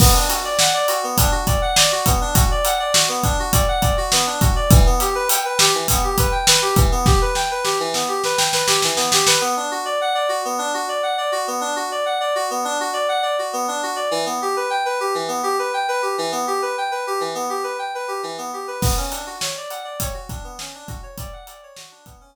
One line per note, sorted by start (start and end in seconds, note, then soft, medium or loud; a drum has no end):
0.00 0.13 B3 medium
0.00 kick medium
0.00 crash medium
0.14 0.27 D4 medium
0.29 0.42 F#4 medium
0.29 closed hi-hat medium
0.44 0.58 D5 medium
0.59 0.73 F#5 medium
0.59 snare medium
0.74 0.87 D5 medium
0.88 1.02 F#4 medium
0.88 closed hi-hat medium
1.03 1.17 B3 medium
1.17 1.31 D4 medium
1.17 kick medium
1.17 closed hi-hat medium
1.31 1.45 F#4 medium
1.47 1.60 D5 medium
1.47 kick medium
1.47 closed hi-hat medium
1.62 1.75 F#5 medium
1.76 1.90 D5 medium
1.76 snare loud
1.92 2.05 F#4 medium
2.06 2.20 B3 medium
2.06 kick medium
2.06 closed hi-hat medium
2.21 2.34 D4 medium
2.34 2.48 F#4 medium
2.34 kick medium
2.34 closed hi-hat medium
2.51 2.64 D5 medium
2.65 2.78 F#5 medium
2.65 closed hi-hat medium
2.79 2.93 D5 medium
2.94 3.07 F#4 medium
2.94 snare loud
3.08 3.22 B3 medium
3.24 3.37 D4 medium
3.24 kick medium
3.24 closed hi-hat medium
3.39 3.53 F#4 medium
3.52 3.66 D5 medium
3.52 kick medium
3.52 closed hi-hat medium
3.68 3.81 F#5 medium
3.81 3.95 D5 medium
3.81 kick medium
3.81 closed hi-hat medium
3.97 4.11 F#4 medium
4.12 4.25 B3 medium
4.12 snare medium
4.27 4.40 D4 medium
4.41 4.54 F#4 medium
4.41 kick medium
4.41 closed hi-hat medium
4.56 4.69 D5 medium
4.71 4.84 E3 medium
4.71 kick loud
4.71 closed hi-hat medium
4.86 4.99 B3 medium
5.00 5.14 G4 medium
5.00 closed hi-hat medium
5.15 5.28 B4 medium
5.29 5.43 G5 medium
5.29 closed hi-hat loud
5.45 5.58 B4 medium
5.59 5.72 G4 medium
5.59 snare loud
5.75 5.88 E3 medium
5.88 6.02 B3 medium
5.88 kick medium
5.88 closed hi-hat loud
6.04 6.17 G4 medium
6.18 6.32 B4 medium
6.18 kick medium
6.18 closed hi-hat medium
6.32 6.45 G5 medium
6.47 6.61 B4 medium
6.47 snare loud
6.62 6.75 G4 medium
6.76 6.90 E3 medium
6.76 kick medium
6.76 closed hi-hat medium
6.92 7.05 B3 medium
7.06 7.19 G4 medium
7.06 kick medium
7.06 snare medium
7.21 7.35 B4 medium
7.35 7.48 G5 medium
7.35 snare medium
7.51 7.64 B4 medium
7.64 7.77 G4 medium
7.64 snare medium
7.80 7.93 E3 medium
7.94 8.07 B3 medium
7.94 snare medium
8.08 8.22 G4 medium
8.24 8.37 B4 medium
8.24 snare medium
8.38 8.51 G5 medium
8.38 snare medium
8.53 8.67 B4 medium
8.53 snare medium
8.67 8.80 G4 medium
8.67 snare medium
8.82 8.97 E3 medium
8.82 snare medium
8.96 9.10 B3 medium
8.96 snare medium
9.12 9.26 G4 medium
9.12 snare medium
9.27 9.40 B4 medium
9.27 snare medium
9.41 9.54 B3 medium
9.57 9.70 D4 medium
9.71 9.84 F#4 medium
9.85 9.98 D5 medium
10.01 10.14 F#5 medium
10.15 10.28 D5 medium
10.29 10.42 F#4 medium
10.45 10.58 B3 medium
10.58 10.72 D4 medium
10.74 10.87 F#4 medium
10.89 11.02 D5 medium
11.03 11.16 F#5 medium
11.18 11.31 D5 medium
11.32 11.45 F#4 medium
11.47 11.61 B3 medium
11.61 11.74 D4 medium
11.76 11.89 F#4 medium
11.92 12.05 D5 medium
12.06 12.19 F#5 medium
12.20 12.34 D5 medium
12.35 12.49 F#4 medium
12.50 12.64 B3 medium
12.65 12.78 D4 medium
12.80 12.94 F#4 medium
12.93 13.06 D5 medium
13.08 13.22 F#5 medium
13.22 13.36 D5 medium
13.39 13.52 F#4 medium
13.53 13.66 B3 medium
13.68 13.81 D4 medium
13.83 13.96 F#4 medium
13.96 14.09 D5 medium
14.11 14.24 E3 medium
14.26 14.39 B3 medium
14.42 14.55 G4 medium
14.56 14.70 B4 medium
14.70 14.83 G5 medium
14.85 14.99 B4 medium
15.00 15.13 G4 medium
15.15 15.28 E3 medium
15.28 15.41 B3 medium
15.43 15.56 G4 medium
15.59 15.72 B4 medium
15.74 15.87 G5 medium
15.88 16.01 B4 medium
16.02 16.15 G4 medium
16.18 16.31 E3 medium
16.32 16.45 B3 medium
16.47 16.61 G4 medium
16.62 16.75 B4 medium
16.78 16.91 G5 medium
16.91 17.05 B4 medium
17.07 17.20 G4 medium
17.20 17.34 E3 medium
17.35 17.48 B3 medium
17.50 17.63 G4 medium
17.63 17.77 B4 medium
17.79 17.92 G5 medium
17.95 18.08 B4 medium
18.08 18.21 G4 medium
18.23 18.36 E3 medium
18.38 18.51 B3 medium
18.53 18.67 G4 medium
18.68 18.81 B4 medium
18.81 18.95 B3 medium
18.81 kick loud
18.81 crash medium
18.97 19.11 C#4 medium
19.11 19.24 D4 medium
19.11 closed hi-hat medium
19.26 19.40 F#4 medium
19.41 19.54 C#5 medium
19.41 snare loud
19.57 19.70 D5 medium
19.70 19.83 F#5 medium
19.70 closed hi-hat medium
19.84 19.97 D5 medium
20.00 20.14 C#5 medium
20.00 kick medium
20.00 closed hi-hat loud
20.14 20.27 F#4 medium
20.29 20.42 D4 medium
20.29 kick medium
20.29 closed hi-hat medium
20.44 20.57 B3 medium
20.59 20.73 C#4 medium
20.59 snare medium
20.75 20.88 D4 medium
20.88 21.01 F#4 medium
20.88 kick medium
20.88 closed hi-hat medium
21.03 21.16 C#5 medium
21.18 21.31 D5 medium
21.18 kick medium
21.18 closed hi-hat medium
21.33 21.46 F#5 medium
21.47 21.61 D5 medium
21.47 closed hi-hat medium
21.63 21.76 C#5 medium
21.76 21.90 F#4 medium
21.76 snare loud
21.91 22.05 D4 medium
22.06 22.19 B3 medium
22.06 kick medium
22.06 closed hi-hat medium
22.21 22.34 C#4 medium